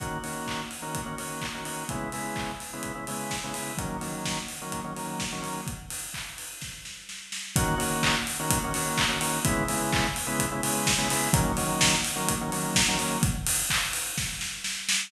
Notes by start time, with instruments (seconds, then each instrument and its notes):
0.00 drawbar organ D#3 A#3 C#4 F#4, kick, closed hi-hat
0.24 drawbar organ D#3 A#3 C#4 F#4, open hi-hat
0.47 kick, clap
0.71 open hi-hat
0.82 drawbar organ D#3 A#3 C#4 F#4
0.95 kick, closed hi-hat
1.06 drawbar organ D#3 A#3 C#4 F#4
1.18 drawbar organ D#3 A#3 C#4 F#4, open hi-hat
1.42 kick, clap
1.55 drawbar organ D#3 A#3 C#4 F#4
1.65 drawbar organ D#3 A#3 C#4 F#4, open hi-hat
1.89 drawbar organ C#3 G#3 B3 E4, kick, closed hi-hat
2.12 drawbar organ C#3 G#3 B3 E4, open hi-hat
2.36 kick, clap
2.60 open hi-hat
2.73 drawbar organ C#3 G#3 B3 E4
2.83 kick, closed hi-hat
2.95 drawbar organ C#3 G#3 B3 E4
3.07 drawbar organ C#3 G#3 B3 E4, open hi-hat
3.31 kick, snare
3.44 drawbar organ C#3 G#3 B3 E4
3.54 drawbar organ C#3 G#3 B3 E4, open hi-hat
3.78 drawbar organ D#3 F#3 A#3 C#4, kick, closed hi-hat
4.01 drawbar organ D#3 F#3 A#3 C#4, open hi-hat
4.25 kick, snare
4.48 open hi-hat
4.62 drawbar organ D#3 F#3 A#3 C#4
4.72 kick, closed hi-hat
4.84 drawbar organ D#3 F#3 A#3 C#4
4.96 drawbar organ D#3 F#3 A#3 C#4, open hi-hat
5.20 kick, snare
5.32 drawbar organ D#3 F#3 A#3 C#4
5.42 drawbar organ D#3 F#3 A#3 C#4, open hi-hat
5.67 kick, closed hi-hat
5.90 open hi-hat
6.14 kick, clap
6.38 open hi-hat
6.61 kick, snare
6.85 snare
7.09 snare
7.32 snare
7.56 drawbar organ D#3 A#3 C#4 F#4, kick, closed hi-hat
7.78 drawbar organ D#3 A#3 C#4 F#4, open hi-hat
8.03 kick, clap
8.27 open hi-hat
8.39 drawbar organ D#3 A#3 C#4 F#4
8.50 kick, closed hi-hat
8.64 drawbar organ D#3 A#3 C#4 F#4
8.74 drawbar organ D#3 A#3 C#4 F#4, open hi-hat
8.98 kick, clap
9.09 drawbar organ D#3 A#3 C#4 F#4
9.20 drawbar organ D#3 A#3 C#4 F#4, open hi-hat
9.45 drawbar organ C#3 G#3 B3 E4, kick, closed hi-hat
9.68 drawbar organ C#3 G#3 B3 E4, open hi-hat
9.92 kick, clap
10.16 open hi-hat
10.27 drawbar organ C#3 G#3 B3 E4
10.39 kick, closed hi-hat
10.52 drawbar organ C#3 G#3 B3 E4
10.63 drawbar organ C#3 G#3 B3 E4, open hi-hat
10.87 kick, snare
10.98 drawbar organ C#3 G#3 B3 E4
11.10 drawbar organ C#3 G#3 B3 E4, open hi-hat
11.33 drawbar organ D#3 F#3 A#3 C#4, kick, closed hi-hat
11.57 drawbar organ D#3 F#3 A#3 C#4, open hi-hat
11.81 kick, snare
12.05 open hi-hat
12.16 drawbar organ D#3 F#3 A#3 C#4
12.29 kick, closed hi-hat
12.41 drawbar organ D#3 F#3 A#3 C#4
12.52 drawbar organ D#3 F#3 A#3 C#4, open hi-hat
12.75 kick, snare
12.88 drawbar organ D#3 F#3 A#3 C#4
12.98 drawbar organ D#3 F#3 A#3 C#4, open hi-hat
13.23 kick, closed hi-hat
13.47 open hi-hat
13.70 kick, clap
13.93 open hi-hat
14.18 kick, snare
14.41 snare
14.64 snare
14.89 snare